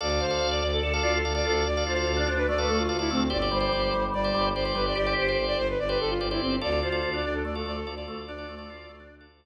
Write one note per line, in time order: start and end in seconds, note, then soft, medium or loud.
0.01 0.18 D2 loud
0.01 0.09 A4 loud
0.01 0.09 D5 loud
0.01 0.20 D5 loud
0.01 0.09 F5 medium
0.09 0.26 A4 medium
0.09 0.26 D5 medium
0.09 0.26 F5 medium
0.20 0.38 D2 medium
0.20 0.47 C5 loud
0.20 0.37 F5 medium
0.31 0.64 A4 medium
0.31 0.64 D5 medium
0.31 0.64 F5 medium
0.41 0.60 D2 medium
0.41 0.51 F5 medium
0.51 0.60 D5 medium
0.51 0.61 D5 medium
0.61 0.80 D2 medium
0.61 0.71 D5 loud
0.61 0.81 D5 medium
0.72 0.82 A4 medium
0.82 0.99 D2 medium
0.82 1.03 A4 medium
0.82 0.92 D5 loud
0.93 1.02 A4 loud
0.93 1.18 A4 medium
0.93 1.18 D5 medium
0.93 1.18 F5 medium
1.03 1.21 D2 medium
1.03 1.20 F4 medium
1.03 1.12 D5 loud
1.15 1.35 A4 medium
1.24 1.42 D2 medium
1.24 1.33 A4 medium
1.24 1.33 D5 medium
1.24 1.33 F5 medium
1.35 1.68 A4 medium
1.35 1.68 D5 medium
1.35 1.45 D5 loud
1.35 1.68 F5 medium
1.45 1.64 D2 medium
1.45 1.55 F4 medium
1.45 1.64 A4 loud
1.65 1.83 D2 medium
1.65 1.83 D5 loud
1.77 1.94 A4 medium
1.77 1.94 D5 medium
1.77 1.94 F5 medium
1.86 2.04 D2 medium
1.86 2.06 F4 medium
1.86 2.12 C5 medium
1.96 2.29 A4 medium
1.96 2.29 D5 medium
1.96 2.29 F5 medium
2.07 2.25 D2 medium
2.07 2.17 F4 medium
2.17 2.27 D4 medium
2.17 2.27 D5 medium
2.27 2.46 D2 medium
2.27 2.47 D4 medium
2.27 2.38 C5 medium
2.37 2.47 B4 loud
2.47 2.64 D2 medium
2.47 2.68 A3 medium
2.47 2.58 D5 loud
2.58 2.83 A4 medium
2.58 2.68 B4 medium
2.58 2.83 D5 medium
2.58 2.83 F5 medium
2.68 2.87 D2 medium
2.68 2.87 A3 medium
2.68 2.78 A4 loud
2.79 2.99 F4 medium
2.89 3.07 D2 medium
2.89 2.97 A4 medium
2.89 2.97 D5 medium
2.89 2.97 F5 medium
2.99 3.10 E4 loud
2.99 3.24 A4 medium
2.99 3.24 D5 medium
2.99 3.24 F5 medium
3.10 3.28 D2 medium
3.10 3.20 A3 medium
3.10 3.28 C4 loud
3.30 3.49 G1 loud
3.30 3.38 G4 loud
3.30 3.38 C5 loud
3.30 3.38 D5 loud
3.30 3.49 D5 loud
3.42 3.58 G4 medium
3.42 3.58 C5 medium
3.42 3.58 D5 loud
3.51 3.69 G1 medium
3.51 3.70 G3 medium
3.51 4.04 C5 loud
3.60 3.94 G4 medium
3.60 3.94 C5 medium
3.60 3.94 D5 medium
3.72 3.91 G1 medium
3.72 3.82 G3 medium
3.82 3.92 G3 medium
3.93 4.11 G1 medium
3.93 4.13 G3 medium
4.14 4.31 G1 medium
4.14 4.33 G3 medium
4.14 4.47 D5 loud
4.24 4.49 G4 medium
4.24 4.49 C5 medium
4.24 4.49 D5 medium
4.34 4.52 G1 medium
4.34 4.52 G3 medium
4.54 4.72 G1 medium
4.54 4.64 G4 medium
4.54 4.74 C5 loud
4.54 4.64 C5 medium
4.54 4.64 D5 medium
4.65 4.98 G4 medium
4.65 4.98 C5 medium
4.65 4.98 D5 medium
4.75 4.93 G1 medium
4.75 4.85 G3 medium
4.75 4.85 B4 loud
4.86 4.96 D5 loud
4.95 5.14 G1 medium
4.95 5.29 G4 medium
4.95 5.14 D5 loud
5.06 5.23 G4 medium
5.06 5.23 C5 medium
5.06 5.23 D5 medium
5.18 5.36 G1 medium
5.18 5.44 C5 loud
5.28 5.62 G4 medium
5.28 5.62 C5 medium
5.28 5.62 D5 medium
5.37 5.55 G1 medium
5.47 5.57 D5 loud
5.57 5.75 G1 medium
5.57 5.68 C5 loud
5.69 5.79 B4 loud
5.79 5.97 G1 medium
5.79 5.89 D5 loud
5.89 6.14 G4 medium
5.89 5.99 B4 loud
5.89 6.14 C5 medium
5.89 6.14 D5 medium
6.00 6.19 G1 medium
6.00 6.10 A4 loud
6.09 6.26 F4 loud
6.20 6.38 G1 medium
6.20 6.29 G4 medium
6.20 6.29 C5 medium
6.20 6.29 D5 medium
6.31 6.41 E4 loud
6.31 6.56 G4 medium
6.31 6.56 C5 medium
6.31 6.56 D5 medium
6.41 6.59 G1 medium
6.41 6.59 C4 loud
6.61 6.81 D2 loud
6.61 6.70 F4 medium
6.61 6.70 A4 medium
6.61 6.70 D5 medium
6.61 6.80 D5 loud
6.72 6.89 F4 medium
6.72 6.89 A4 medium
6.72 6.89 D5 medium
6.83 7.00 D2 medium
6.83 7.01 F4 medium
6.83 7.10 C5 medium
6.92 7.25 F4 medium
6.92 7.25 A4 medium
6.92 7.25 D5 medium
7.03 7.22 D2 medium
7.03 7.13 F4 medium
7.14 7.23 D4 medium
7.14 7.24 D5 medium
7.23 7.42 D2 medium
7.23 7.43 D4 medium
7.23 7.34 D5 loud
7.34 7.44 A4 medium
7.44 7.62 D2 medium
7.44 7.62 A3 medium
7.44 7.55 D5 loud
7.55 7.80 F4 medium
7.55 7.80 A4 medium
7.55 7.66 A4 medium
7.55 7.80 D5 medium
7.65 7.83 D2 medium
7.65 7.83 A3 medium
7.65 7.76 D5 loud
7.76 7.94 A4 loud
7.86 8.03 D2 medium
7.86 7.95 F4 medium
7.86 7.95 A4 medium
7.86 7.95 D5 medium
7.96 8.31 F4 medium
7.96 8.31 A4 medium
7.96 8.06 D5 loud
7.96 8.31 D5 medium
8.06 8.24 D2 medium
8.06 8.18 A3 medium
8.06 8.26 A4 medium
8.27 8.45 D2 medium
8.27 8.47 D4 medium
8.27 9.15 D5 loud
8.38 8.55 F4 medium
8.38 8.55 A4 medium
8.38 8.55 D5 medium
8.48 8.66 D2 medium
8.48 8.68 A3 medium
8.58 8.92 F4 medium
8.58 8.92 A4 medium
8.58 8.92 D5 medium
8.68 8.86 D2 medium
8.68 8.88 F4 medium
8.89 9.07 D2 medium
8.89 8.99 A3 medium
9.00 9.26 D4 medium
9.11 9.28 D2 medium
9.21 9.45 F4 medium
9.21 9.45 A4 medium
9.21 9.45 D5 medium
9.32 9.45 D2 medium